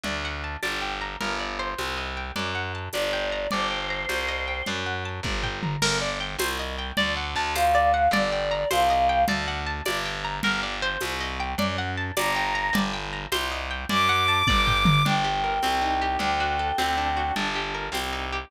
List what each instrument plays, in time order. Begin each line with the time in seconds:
0.04 electric bass (finger) D2, acoustic guitar (steel) D5, low conga
0.25 acoustic guitar (steel) F#5
0.44 acoustic guitar (steel) A5
0.63 electric bass (finger) G1, acoustic guitar (steel) D5, tambourine, high conga
0.82 acoustic guitar (steel) G5
1.01 acoustic guitar (steel) A#5
1.21 electric bass (finger) G1, acoustic guitar (steel) A#4, low conga
1.40 acoustic guitar (steel) D5
1.59 acoustic guitar (steel) C5
1.78 electric bass (finger) C2, tambourine, high conga
1.98 acoustic guitar (steel) D#5
2.17 acoustic guitar (steel) G5
2.36 electric bass (finger) F#2, acoustic guitar (steel) D5, low conga
2.55 acoustic guitar (steel) F#5
2.75 acoustic guitar (steel) A5
2.93 electric bass (finger) G1, acoustic guitar (steel) D5, choir aahs D5, tambourine, high conga
3.13 acoustic guitar (steel) G5
3.32 acoustic guitar (steel) A#5
3.51 electric bass (finger) G1, choir aahs C5, acoustic guitar (steel) D5, low conga
3.71 acoustic guitar (steel) G5
3.90 acoustic guitar (steel) A#5
4.09 electric bass (finger) C2, acoustic guitar (steel) C5, tambourine, high conga
4.28 acoustic guitar (steel) D#5
4.48 acoustic guitar (steel) G5
4.66 electric bass (finger) F#2, acoustic guitar (steel) D5, low conga
4.86 acoustic guitar (steel) F#5
5.05 acoustic guitar (steel) A5
5.23 electric bass (finger) G1, acoustic guitar (steel) D5, kick, high tom
5.43 acoustic guitar (steel) G5, floor tom
5.63 acoustic guitar (steel) A#5, mid tom
5.82 electric bass (finger) G1, acoustic guitar (steel) A#4, crash, low conga
6.01 acoustic guitar (steel) D5
6.20 acoustic guitar (steel) G5
6.39 electric bass (finger) C2, acoustic guitar (steel) C5, tambourine, high conga
6.59 acoustic guitar (steel) D#5
6.79 acoustic guitar (steel) G5
6.97 electric bass (finger) D2, acoustic guitar (steel) D5, low conga
7.17 acoustic guitar (steel) F#5
7.35 electric bass (finger) D2, acoustic guitar (steel) A5
7.55 acoustic guitar (steel) C5, choir aahs F5, tambourine, high conga
7.75 acoustic guitar (steel) D5
7.94 acoustic guitar (steel) F#5
8.11 electric bass (finger) G1, acoustic guitar (steel) D5, choir aahs D5, low conga
8.32 acoustic guitar (steel) G5
8.51 acoustic guitar (steel) A#5
8.71 electric bass (finger) C2, acoustic guitar (steel) C5, choir aahs F5, tambourine, high conga
8.90 acoustic guitar (steel) D#5
9.09 acoustic guitar (steel) G5
9.28 electric bass (finger) D2, acoustic guitar (steel) D5, low conga
9.48 acoustic guitar (steel) F#5
9.67 acoustic guitar (steel) A5
9.85 electric bass (finger) G1, acoustic guitar (steel) D5, tambourine, high conga
10.06 acoustic guitar (steel) G5
10.25 acoustic guitar (steel) A#5
10.43 electric bass (finger) G1, acoustic guitar (steel) A#4, low conga
10.63 acoustic guitar (steel) D5
10.82 acoustic guitar (steel) C5
11.01 electric bass (finger) C2, tambourine, high conga
11.20 acoustic guitar (steel) D#5
11.40 acoustic guitar (steel) G5
11.58 electric bass (finger) F#2, acoustic guitar (steel) D5, low conga
11.78 acoustic guitar (steel) F#5
11.98 acoustic guitar (steel) A5
12.17 electric bass (finger) G1, acoustic guitar (steel) D5, choir aahs A#5, tambourine, high conga
12.36 acoustic guitar (steel) G5
12.55 acoustic guitar (steel) A#5
12.73 electric bass (finger) G1, acoustic guitar (steel) D5, low conga
12.94 acoustic guitar (steel) G5
13.13 acoustic guitar (steel) A#5
13.32 electric bass (finger) C2, acoustic guitar (steel) C5, tambourine, high conga
13.52 acoustic guitar (steel) D#5
13.71 acoustic guitar (steel) G5
13.89 electric bass (finger) F#2, acoustic guitar (steel) D5, choir aahs D6, low conga
14.09 acoustic guitar (steel) F#5
14.28 acoustic guitar (steel) A5
14.47 electric bass (finger) G1, acoustic guitar (steel) D5, kick, high tom
14.67 acoustic guitar (steel) G5, floor tom
14.85 acoustic guitar (steel) A#5, mid tom
15.05 electric bass (finger) G1, acoustic guitar (steel) D4, choir aahs G5, low conga
15.24 acoustic guitar (steel) G4
15.44 acoustic guitar (steel) A#4
15.62 electric bass (finger) C2, acoustic guitar (steel) C4, tambourine, high conga
15.82 acoustic guitar (steel) D#4
16.02 acoustic guitar (steel) G4
16.19 electric bass (finger) D2, acoustic guitar (steel) D4, choir aahs G5, low conga
16.40 acoustic guitar (steel) F#4
16.59 acoustic guitar (steel) A4
16.78 electric bass (finger) D2, acoustic guitar (steel) C4, tambourine, high conga
16.98 acoustic guitar (steel) D4
17.17 acoustic guitar (steel) F#4
17.36 electric bass (finger) G1, acoustic guitar (steel) D4, low conga
17.55 acoustic guitar (steel) G4
17.75 acoustic guitar (steel) A#4
17.92 electric bass (finger) C2, acoustic guitar (steel) C4, tambourine, high conga
18.13 acoustic guitar (steel) D#4
18.33 acoustic guitar (steel) G4